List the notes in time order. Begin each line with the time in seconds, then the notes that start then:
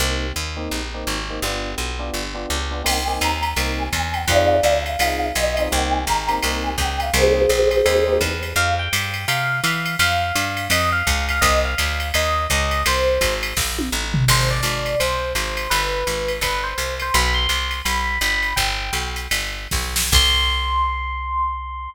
0.00 C2 A#3 C4 D#4 G4
0.36 D#2
0.57 A#3 C4 D#4 G4
0.71 A#1
0.94 A#3 C4 D#4 G4
1.07 G#1
1.30 A#3 C4 D#4 G4
1.42 G1 B3 D4 F4 G4
1.78 B1
1.99 B3 D4 F4 G4
2.14 G1
2.35 B3 D4 F4 G4
2.50 C#2
2.71 B3 D4 F4 G4
2.84 C2 A#3 C4 D#4 G4 G5, crash, ride
3.07 A#3 C4 D#4 G4 G#5
3.21 D#2 A#5, hi-hat pedal, ride
3.43 ride
3.56 C2 A#3 C4 D#4 G4, ride
3.78 G#5
3.93 E2 G#5, kick, hi-hat pedal, ride
4.13 G5, ride
4.28 F2 C4 D#4 F4 G#4 D5 F5, kick, ride
4.63 D2, hi-hat pedal, ride
4.86 F5, ride
4.99 C2 C4 D#4 F4 G#4, ride
5.35 B1 D#5, hi-hat pedal, ride
5.57 C4 D#4 F4 G#4, ride
5.72 C2 A#3 C4 D#4 G4 G5, kick
5.92 G#5
6.05 G#1 A#5, kick, hi-hat pedal, ride
6.28 A#3 C4 D#4 G4, ride
6.43 C2 A#3 C4 D#4 G4, ride
6.63 G#5
6.78 C#2 G5, kick, hi-hat pedal, ride
7.00 F5, ride
7.14 C2 A#3 C4 D#4 G4 G#4 C5, ride
7.49 A#1, hi-hat pedal, ride
7.71 ride
7.86 D#2 A#3 C4 D#4 G4, ride
8.08 A#3 C4 D#4 G4
8.21 E2, kick, hi-hat pedal, ride
8.43 ride
8.56 F2 F5
8.79 G5
8.93 G2, hi-hat pedal, ride
9.14 ride
9.28 C3 F5, ride
9.64 E3 F5, hi-hat pedal, ride
9.86 ride
9.99 F2 F5, ride
10.35 G2, hi-hat pedal, ride
10.57 ride
10.70 F2 D#5, ride
10.92 F5
11.07 C#2, kick, hi-hat pedal, ride
11.29 F5, ride
11.41 C2 D#5, kick, ride
11.65 F5
11.78 D2, hi-hat pedal, ride
12.00 ride
12.14 D#2 D#5, ride
12.50 C#2 D#5, kick, hi-hat pedal, ride
12.71 ride
12.86 C2 C5, ride
13.21 G#1, kick, hi-hat pedal, ride
13.43 ride
13.57 A#1, kick, snare
13.79 high tom
13.92 A1
14.14 floor tom
14.28 G#1 C5, crash, ride
14.50 D5
14.63 G#1, hi-hat pedal, ride
14.86 ride
15.00 C2 C5, ride
15.35 G#1 C5, hi-hat pedal, ride
15.57 ride
15.70 G1 B4, ride
16.07 G#1, hi-hat pedal, ride
16.28 ride
16.41 G1 B4, kick, ride
16.64 C5
16.78 C2, hi-hat pedal, ride
17.00 C5, ride
17.14 B1 B5, ride
17.34 C6
17.49 C2, hi-hat pedal, ride
17.71 ride
17.85 B1 B5, ride
18.21 G1 B5, hi-hat pedal, ride
18.43 ride
18.56 G1 G5, kick, ride
18.93 B1, ride
19.16 hi-hat pedal, ride
19.31 G1, ride
19.71 B1, kick, snare
19.96 snare
20.12 C2 C6, kick, crash